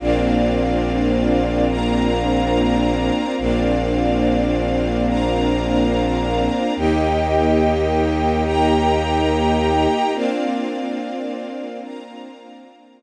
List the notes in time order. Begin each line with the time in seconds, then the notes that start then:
0.00 A#1 A#3 C4 D4 F4 A#4 C5 D5 F5
1.69 A#4 C5 F5 A#5
3.38 A#1 A#3 C4 D4 F4 A#4 C5 D5 F5
5.07 A#4 C5 F5 A#5
6.76 D#2 A#3 D#4 G4 A#4 D#5 G5
8.45 A#4 G5 A#5
10.14 A#3 C4 D4 F4 A#4 C5 D5 F5
11.83 A#4 C5 F5 A#5